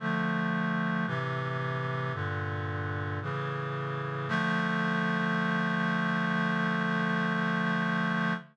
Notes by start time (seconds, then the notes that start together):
0.00 D3 F3 A3
1.06 A2 C3 E3
2.13 G2 A#2 D3
3.22 A2 C#3 E3
4.29 D3 F3 A3